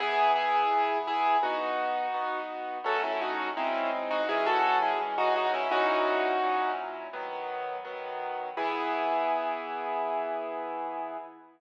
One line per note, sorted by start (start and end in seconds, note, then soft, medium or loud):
0.00 0.64 E3 loud
0.00 0.64 B3 loud
0.00 0.31 E4 loud
0.00 0.31 G#4 loud
0.36 0.98 E4 medium
0.36 0.98 G#4 loud
0.71 1.35 E3 medium
0.71 1.35 B3 medium
0.71 1.35 G#4 medium
1.07 1.37 E4 medium
1.07 1.37 G#4 loud
1.42 2.06 B3 medium
1.42 2.40 D#4 medium
1.42 2.40 F#4 medium
2.14 2.78 B3 medium
2.14 2.78 D#4 medium
2.14 2.78 F#4 medium
2.84 3.49 F#3 loud
2.84 3.49 A3 medium
2.84 3.49 C#4 medium
2.84 3.03 F#4 medium
2.84 3.03 A4 loud
3.04 3.21 C#4 medium
3.04 3.21 E4 medium
3.21 3.50 D#4 medium
3.21 3.50 F#4 medium
3.57 4.21 G#3 medium
3.57 4.21 C4 medium
3.57 3.90 C#4 medium
3.57 4.21 D#4 medium
3.57 3.90 E4 medium
4.11 4.28 D#4 medium
4.11 4.28 F#4 loud
4.29 4.93 E3 medium
4.29 4.93 G#3 medium
4.29 4.93 C#4 medium
4.29 4.46 E4 medium
4.29 4.46 G#4 loud
4.46 4.78 F#4 loud
4.46 4.78 A4 loud
4.82 4.99 E4 medium
4.82 4.99 G#4 medium
5.00 5.65 E3 medium
5.00 5.65 G#3 medium
5.00 5.65 C#4 medium
5.18 5.35 D#4 loud
5.18 5.35 F#4 loud
5.36 5.53 D#4 medium
5.36 5.53 F#4 loud
5.54 5.71 C#4 medium
5.54 5.71 E4 loud
5.71 6.35 A#2 medium
5.71 6.35 F#3 medium
5.71 6.35 C#4 medium
5.71 6.72 D#4 loud
5.71 6.35 E4 medium
5.71 6.72 F#4 loud
6.43 7.07 A#2 medium
6.43 7.07 F#3 medium
6.43 7.07 C#4 medium
6.43 7.07 E4 medium
7.13 7.78 D#3 medium
7.13 7.78 F#3 medium
7.13 7.78 B3 loud
7.85 8.49 D#3 medium
7.85 8.49 F#3 medium
7.85 8.49 B3 medium
8.57 11.17 E3 loud
8.57 11.17 B3 loud
8.57 11.17 E4 loud
8.57 11.17 G#4 loud